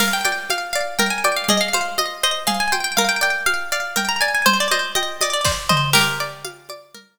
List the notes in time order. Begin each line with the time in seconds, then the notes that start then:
0.00 A#4 F5, crash, low conga
0.13 G5
0.25 D5 G5, high conga
0.50 F5, high conga
0.73 D5 F5
0.99 A#4 G5, low conga
1.10 G#5
1.24 D5 G5, high conga
1.36 F5
1.49 G#4 D#5, low conga
1.61 F5
1.73 C5 F5, high conga
1.98 D#5, high conga
2.23 C5 D#5
2.47 G#4 F5, low conga
2.60 G#5
2.72 C5 G5, high conga
2.84 G5
2.97 A#4 F5, low conga
3.09 G5
3.21 D5 G5
3.46 F5, high conga
3.72 D5 F5
3.96 A#4 G5, low conga
4.09 A#5
4.21 D5 G#5
4.35 G#5
4.46 C5, low conga
4.60 D5
4.71 C5 D#5, high conga
4.95 D#5 G5, high conga
5.21 D5 D#5, high conga
5.33 D5
5.45 C5 D5, kick, snare
5.69 C5 D#5, mid tom
5.93 G4 A#4, crash, low conga
6.20 D5
6.45 F5, high conga
6.69 D5, high conga
6.95 A#4, low conga